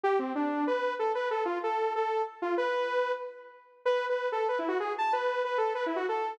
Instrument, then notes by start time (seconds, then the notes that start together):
lead 2 (sawtooth)
0.04 G4
0.19 C4
0.35 D4
0.67 B4
0.99 A4
1.15 B4
1.31 A4
1.45 F4
1.63 A4
1.96 A4
2.42 F4
2.57 B4
3.85 B4
4.09 B4
4.32 A4
4.48 B4
4.59 E4
4.68 F#4
4.80 G#4
4.98 A5
5.13 B4
5.44 B4
5.58 A4
5.75 B4
5.86 E4
5.96 F#4
6.09 A4